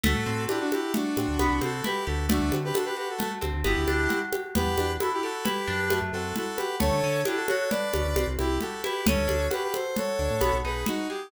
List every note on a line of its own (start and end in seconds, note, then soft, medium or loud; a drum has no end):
0.03 0.14 D2 loud
0.03 0.24 A3 loud
0.03 0.44 F#4 medium
0.03 0.44 A4 medium
0.03 low conga loud
0.15 0.25 A2 medium
0.26 0.47 A2 medium
0.26 0.47 C4 medium
0.49 0.70 D4 medium
0.49 0.59 E4 medium
0.49 0.59 G4 medium
0.49 high conga medium
0.60 0.71 D4 medium
0.60 0.71 F#4 medium
0.71 0.93 E4 medium
0.71 0.92 F#4 medium
0.71 0.93 G4 medium
0.71 high conga medium
0.94 1.14 A3 medium
0.94 1.59 D4 medium
0.94 1.59 F#4 medium
0.94 low conga medium
1.17 1.27 A2 medium
1.17 1.38 C4 medium
1.17 high conga medium
1.28 1.38 D2 medium
1.39 1.49 C2 medium
1.39 1.60 B3 loud
1.39 high conga medium
1.50 1.61 C2 medium
1.61 1.82 C3 medium
1.61 1.81 C4 medium
1.61 1.85 F#4 medium
1.61 1.85 A4 medium
1.61 high conga medium
1.84 2.05 E4 medium
1.84 2.05 G4 medium
1.84 2.05 B4 medium
1.84 low conga medium
2.06 2.40 D2 medium
2.06 2.26 F#4 medium
2.06 2.27 G4 medium
2.06 2.26 A4 medium
2.29 2.49 A3 loud
2.29 2.56 D4 medium
2.29 2.56 F#4 medium
2.29 low conga loud
2.41 2.51 D2 medium
2.52 2.72 D3 medium
2.52 2.74 C4 medium
2.52 high conga medium
2.64 2.75 G4 medium
2.64 2.75 B4 medium
2.74 2.94 D4 medium
2.74 2.85 F#4 medium
2.74 2.85 A4 medium
2.74 high conga medium
2.85 2.96 G4 medium
2.85 2.96 B4 medium
2.96 3.17 F#4 medium
2.96 3.08 G4 medium
2.96 3.08 B4 medium
3.09 3.19 F#4 soft
3.09 3.19 A4 medium
3.19 3.39 A3 medium
3.19 3.31 F#4 medium
3.19 3.31 A4 medium
3.19 low conga medium
3.41 3.53 D2 medium
3.41 3.62 C4 medium
3.41 high conga medium
3.53 3.64 D2 medium
3.64 3.75 G1 loud
3.64 3.85 B3 medium
3.64 4.19 E4 medium
3.64 4.19 G4 medium
3.64 high conga medium
3.76 3.86 D2 medium
3.88 4.08 D2 medium
3.88 4.08 D4 medium
3.88 high conga medium
4.09 4.29 F#4 medium
4.09 low conga medium
4.33 4.53 G4 medium
4.33 high conga medium
4.55 4.65 E2 loud
4.55 4.75 B3 medium
4.55 4.91 G4 medium
4.55 4.91 B4 medium
4.55 low conga loud
4.66 4.76 E2 medium
4.77 4.98 E2 medium
4.77 4.98 D4 medium
4.77 high conga medium
5.00 5.21 E4 medium
5.00 5.11 F#4 medium
5.00 5.11 A4 medium
5.00 high conga medium
5.13 5.24 E4 medium
5.13 5.24 G4 medium
5.23 5.44 F#4 medium
5.23 5.43 G4 medium
5.23 5.44 A4 medium
5.44 5.65 E4 medium
5.44 5.99 G4 medium
5.44 5.99 B4 medium
5.44 low conga medium
5.67 6.00 F#2 medium
5.67 5.88 D4 medium
5.90 6.10 A3 medium
5.90 high conga medium
6.02 6.12 F#2 medium
6.13 6.33 F#2 medium
6.13 6.34 C4 medium
6.13 6.35 F#4 medium
6.13 6.35 A4 medium
6.36 6.56 E4 medium
6.36 6.58 F#4 medium
6.36 6.58 A4 medium
6.36 low conga medium
6.57 6.79 F#4 medium
6.57 6.75 G4 medium
6.57 6.75 B4 medium
6.57 high conga medium
6.80 6.91 D2 medium
6.80 7.00 A3 medium
6.80 7.21 A4 medium
6.80 7.21 C#5 medium
6.80 low conga loud
6.92 7.02 D3 medium
7.04 7.24 D3 medium
7.04 7.24 C#4 medium
7.25 7.46 D4 medium
7.25 7.37 E4 medium
7.25 7.37 G4 medium
7.25 high conga medium
7.36 7.47 F#4 medium
7.36 7.47 A4 medium
7.48 7.70 F#4 medium
7.48 7.69 A4 medium
7.48 7.69 C#5 medium
7.48 high conga medium
7.70 7.92 D4 medium
7.70 8.27 B4 medium
7.70 8.27 D5 medium
7.70 low conga medium
7.93 8.04 D2 medium
7.93 8.13 C#4 medium
7.93 high conga medium
8.05 8.15 D2 medium
8.16 8.26 C2 medium
8.16 8.36 C4 medium
8.16 high conga medium
8.27 8.37 C2 medium
8.39 8.59 C2 medium
8.39 8.58 E4 medium
8.39 8.59 E4 medium
8.39 8.58 G4 medium
8.39 high conga medium
8.61 8.82 F#4 medium
8.61 8.82 G4 medium
8.61 8.82 A4 medium
8.61 low conga medium
8.84 9.04 E4 medium
8.84 9.06 G4 medium
8.84 9.06 B4 medium
8.84 high conga medium
9.06 9.16 D2 medium
9.06 9.27 C#4 medium
9.06 9.47 A4 medium
9.06 9.47 C#5 medium
9.06 low conga loud
9.17 9.28 D2 medium
9.28 9.49 D2 medium
9.28 9.48 D4 medium
9.28 high conga medium
9.50 9.71 F#4 medium
9.50 9.62 G4 medium
9.50 9.62 B4 medium
9.50 high conga medium
9.63 9.74 G4 medium
9.63 9.74 B4 medium
9.74 9.95 A4 medium
9.74 9.96 C5 medium
9.74 high conga medium
9.96 10.17 F#4 medium
9.96 10.56 A4 medium
9.96 10.56 C#5 medium
9.96 low conga medium
10.19 10.29 D2 medium
10.19 10.39 D4 medium
10.30 10.41 A2 medium
10.41 10.52 B1 medium
10.41 10.61 B3 medium
10.41 high conga medium
10.53 10.63 B1 medium
10.64 10.84 B1 medium
10.64 10.85 D#4 medium
10.64 10.85 G#4 medium
10.64 10.85 B4 medium
10.86 11.07 D#4 medium
10.86 11.07 F#4 medium
10.86 low conga medium
11.09 11.29 G4 medium
11.09 11.30 G#4 medium